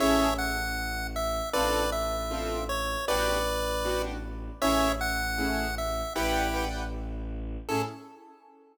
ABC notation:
X:1
M:4/4
L:1/8
Q:1/4=156
K:Amix
V:1 name="Lead 1 (square)"
[ce]2 f4 e2 | [Bd]2 e4 c2 | [Bd]5 z3 | [ce]2 f4 e2 |
[EG]3 z5 | A2 z6 |]
V:2 name="Acoustic Grand Piano"
[CE^GA]8 | [=CD=FA]4 [CDFA]4 | [B,DFG]4 [B,DFG]4 | [A,CE^G]4 [A,CEG]4 |
[Bdfg]2 [Bdfg]6 | [CE^GA]2 z6 |]
V:3 name="Violin" clef=bass
A,,,8 | A,,,8 | A,,,8 | A,,,8 |
A,,,8 | A,,2 z6 |]